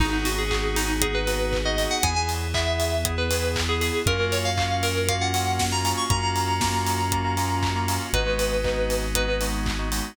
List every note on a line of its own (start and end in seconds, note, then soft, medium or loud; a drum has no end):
0.00 1.86 G#1 loud
0.00 0.10 B3 medium
0.00 2.02 B3 loud
0.00 0.10 D#4 medium
0.00 0.25 D#4 medium
0.00 2.02 D#4 loud
0.00 0.10 F#4 medium
0.00 2.02 F#4 loud
0.00 0.10 G#4 medium
0.00 2.02 G#4 medium
0.00 kick loud
0.00 crash medium
0.13 0.43 B3 medium
0.13 0.43 D#4 medium
0.13 0.43 F#4 medium
0.13 0.43 G#4 medium
0.25 0.38 F#4 medium
0.25 open hi-hat medium
0.38 0.76 G#4 medium
0.51 0.92 B3 medium
0.51 0.92 D#4 medium
0.51 0.92 F#4 medium
0.51 0.92 G#4 medium
0.51 kick medium
0.51 clap loud
0.76 1.01 D#4 medium
0.76 open hi-hat medium
1.01 1.12 B3 medium
1.01 1.12 D#4 medium
1.01 1.12 F#4 medium
1.01 1.14 G#4 medium
1.01 1.12 G#4 medium
1.01 kick medium
1.01 closed hi-hat loud
1.14 1.25 B3 medium
1.14 1.25 D#4 medium
1.14 1.25 F#4 medium
1.14 1.25 G#4 medium
1.14 1.61 B4 medium
1.27 1.58 B3 medium
1.27 1.58 D#4 medium
1.27 1.58 F#4 medium
1.27 1.58 G#4 medium
1.27 open hi-hat medium
1.53 kick medium
1.53 clap medium
1.65 1.75 B3 medium
1.65 1.75 D#4 medium
1.65 1.75 F#4 medium
1.65 1.75 G#4 medium
1.65 1.87 D#5 medium
1.78 1.98 B3 medium
1.78 1.98 D#4 medium
1.78 1.98 F#4 medium
1.78 1.98 G#4 medium
1.78 open hi-hat medium
1.91 2.03 F#5 medium
2.03 3.90 E2 loud
2.03 4.05 B3 medium
2.03 2.14 B3 medium
2.03 4.05 E4 medium
2.03 2.14 E4 medium
2.03 4.05 G#4 medium
2.03 2.14 G#4 medium
2.03 2.15 G#5 medium
2.03 kick loud
2.03 closed hi-hat loud
2.16 2.47 B3 medium
2.16 2.47 E4 medium
2.16 2.47 G#4 medium
2.16 2.28 G#5 medium
2.29 open hi-hat medium
2.54 2.95 B3 medium
2.54 2.95 E4 medium
2.54 2.95 G#4 medium
2.54 3.01 E5 medium
2.54 kick medium
2.54 clap loud
2.80 open hi-hat medium
3.05 3.15 B3 medium
3.05 3.15 E4 medium
3.05 3.15 G#4 medium
3.05 kick medium
3.05 closed hi-hat loud
3.18 3.28 B3 medium
3.18 3.28 E4 medium
3.18 3.28 G#4 medium
3.18 3.52 B4 medium
3.31 3.61 B3 medium
3.31 3.61 E4 medium
3.31 3.61 G#4 medium
3.31 open hi-hat medium
3.56 kick medium
3.56 clap loud
3.69 3.79 B3 medium
3.69 3.79 E4 medium
3.69 3.79 G#4 medium
3.69 3.81 G#4 medium
3.81 4.02 B3 medium
3.81 4.02 E4 medium
3.81 4.02 G#4 medium
3.81 4.03 G#4 medium
3.81 open hi-hat medium
4.06 5.93 F#2 loud
4.06 6.08 A#3 loud
4.06 4.17 A#3 medium
4.06 6.08 C#4 loud
4.06 4.17 C#4 medium
4.06 6.08 F4 loud
4.06 4.17 F4 medium
4.06 6.08 F#4 medium
4.06 4.17 F#4 medium
4.06 4.32 A#4 loud
4.06 kick loud
4.06 closed hi-hat medium
4.19 4.50 A#3 medium
4.19 4.50 C#4 medium
4.19 4.50 F4 medium
4.19 4.50 F#4 medium
4.32 4.44 C#5 medium
4.32 open hi-hat medium
4.45 4.82 F5 medium
4.58 4.98 A#3 medium
4.58 4.98 C#4 medium
4.58 4.98 F4 medium
4.58 4.98 F#4 medium
4.58 kick medium
4.58 clap loud
4.83 5.08 A#4 medium
4.83 open hi-hat medium
5.08 5.19 A#3 medium
5.08 5.19 C#4 medium
5.08 5.19 F4 medium
5.08 5.19 F#4 medium
5.08 5.21 F5 medium
5.08 kick medium
5.08 closed hi-hat loud
5.21 5.31 A#3 medium
5.21 5.31 C#4 medium
5.21 5.31 F4 medium
5.21 5.31 F#4 medium
5.21 5.64 F#5 medium
5.34 5.64 A#3 medium
5.34 5.64 C#4 medium
5.34 5.64 F4 medium
5.34 5.64 F#4 medium
5.34 open hi-hat medium
5.59 kick medium
5.59 snare loud
5.72 5.82 A#3 medium
5.72 5.82 C#4 medium
5.72 5.82 F4 medium
5.72 5.82 F#4 medium
5.72 5.92 A#5 medium
5.85 6.05 A#3 medium
5.85 6.05 C#4 medium
5.85 6.05 F4 medium
5.85 6.05 F#4 medium
5.85 open hi-hat medium
5.97 6.09 C#6 medium
6.10 7.98 F#2 loud
6.10 6.20 A#3 medium
6.10 8.12 A#3 loud
6.10 6.20 C#4 loud
6.10 8.12 C#4 medium
6.10 6.20 F4 medium
6.10 8.12 F4 loud
6.10 6.20 F#4 medium
6.10 8.12 F#4 loud
6.10 7.95 A#5 medium
6.10 kick loud
6.10 closed hi-hat medium
6.23 6.53 A#3 medium
6.23 6.53 C#4 medium
6.23 6.53 F4 medium
6.23 6.53 F#4 medium
6.36 open hi-hat medium
6.61 7.02 A#3 medium
6.61 7.02 C#4 medium
6.61 7.02 F4 medium
6.61 7.02 F#4 medium
6.61 kick medium
6.61 snare loud
6.87 open hi-hat medium
7.12 7.22 A#3 medium
7.12 7.22 C#4 medium
7.12 7.22 F4 medium
7.12 7.22 F#4 medium
7.12 kick medium
7.12 closed hi-hat medium
7.25 7.35 A#3 medium
7.25 7.35 C#4 medium
7.25 7.35 F4 medium
7.25 7.35 F#4 medium
7.37 7.68 A#3 medium
7.37 7.68 C#4 medium
7.37 7.68 F4 medium
7.37 7.68 F#4 medium
7.37 open hi-hat medium
7.63 kick medium
7.63 clap loud
7.75 7.86 A#3 medium
7.75 7.86 C#4 medium
7.75 7.86 F4 medium
7.75 7.86 F#4 medium
7.88 8.08 A#3 medium
7.88 8.08 C#4 medium
7.88 8.08 F4 medium
7.88 8.08 F#4 medium
7.88 open hi-hat medium
8.13 10.00 G#1 loud
8.13 10.15 G#3 loud
8.13 8.24 G#3 medium
8.13 10.15 B3 medium
8.13 8.24 B3 medium
8.13 10.15 D#4 loud
8.13 8.24 D#4 medium
8.13 10.15 F#4 medium
8.13 8.24 F#4 medium
8.13 8.96 B4 medium
8.13 kick medium
8.13 closed hi-hat medium
8.26 8.57 G#3 medium
8.26 8.57 B3 medium
8.26 8.57 D#4 medium
8.26 8.57 F#4 medium
8.39 open hi-hat medium
8.64 9.05 G#3 medium
8.64 9.05 B3 medium
8.64 9.05 D#4 medium
8.64 9.05 F#4 medium
8.64 kick medium
8.64 clap medium
8.90 open hi-hat medium
9.15 9.25 G#3 medium
9.15 9.25 B3 medium
9.15 9.25 D#4 medium
9.15 9.25 F#4 medium
9.15 9.40 B4 medium
9.15 kick medium
9.15 closed hi-hat loud
9.28 9.38 G#3 medium
9.28 9.38 B3 medium
9.28 9.38 D#4 medium
9.28 9.38 F#4 medium
9.41 9.71 G#3 medium
9.41 9.71 B3 medium
9.41 9.71 D#4 medium
9.41 9.71 F#4 medium
9.41 open hi-hat medium
9.66 kick medium
9.66 clap loud
9.79 9.89 G#3 medium
9.79 9.89 B3 medium
9.79 9.89 D#4 medium
9.79 9.89 F#4 medium
9.92 10.12 G#3 medium
9.92 10.12 B3 medium
9.92 10.12 D#4 medium
9.92 10.12 F#4 medium
9.92 open hi-hat medium